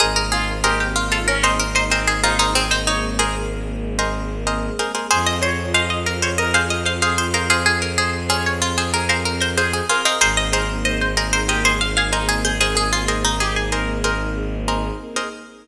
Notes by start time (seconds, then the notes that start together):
0.00 G#1 A#3 C4 D#4 G#4 A#4 C5 D#5
0.16 A#4
0.32 F4 G#4
0.64 G4 G#4 A#4 C5 D#5
0.80 G4
0.96 F4
1.12 F4 A4
1.28 C#4 A#4
1.43 D#4 G#4 A#4 C5 D#5
1.60 A#4
1.75 D#4 C5
1.90 C4 G#4 A#4 C5 D#5
2.07 G#4
2.24 D#4 F4 G#4 A#4 C5 D#5
2.39 D#4 G#4 A#4 C5 D#5
2.55 G#3 A#3 C4 G#4
2.71 D#4 C5
2.87 D#4 C#5
3.19 G#4 A#4 C5 D#5
3.99 G#4 A#4 C5 D#5
4.47 G#4 A#4 C5 D#5
4.79 G#4 A#4 C5 D#5
4.95 G#4 A#4 C5 D#5
5.11 F2 C4 F4 G#4 C5 F5
5.26 D#5
5.42 C5 C#5
5.74 G#4 C5 D#5 F5
5.90 D#5
6.06 A#4
6.22 C5 C#5
6.38 A#4 D#5
6.54 G#4 C5 F5
6.70 D#5
6.86 C5 F5
7.02 G#4 C5 F5
7.18 C5
7.34 G#4 A#4 C5 F5
7.50 G#4 C5 F5
7.66 C4 G#4 C5
7.82 A#4
7.98 G#4 C5
8.29 G#4 C5 C#5 F5
8.46 C#5
8.62 F4
8.78 G#4 C5
8.94 G#4 A#4
9.09 G#4 A#4 C5 F5
9.25 A#4
9.41 A#4 C5
9.57 G#4 C5 F5
9.73 G#4
9.89 F4 G#4 A#4 C5 F5
10.05 D#4 G#4 A#4 C5 F5
10.21 G#1 A#3 C4 D#4 G#4 A#4 C5 D#5
10.37 D#5
10.53 G#4 A#4 C5 D#5
10.85 C5 D#5
11.01 C5
11.17 G#4 A#4 C5 D#5
11.33 A#4 C5
11.48 G4 G#4 A#4 C5 D#5
11.65 G#4 C5
11.81 F5
11.97 G#4 F5
12.12 D#4 G#4 A#4 C5 D#5 G#5
12.29 G#4
12.45 G#4 C5
12.61 G#4 A#4 C5 D#5
12.75 G#4
12.93 F4
13.08 G#4 A#4 C5 D#5
13.24 D#4
13.40 G4 G#4
13.56 G#4
13.72 G#4 A#4 C5 D#5
14.04 G#4 A#4 C5 D#5
14.68 G#4 A#4 C5 D#5
15.16 G#4 A#4 C5 D#5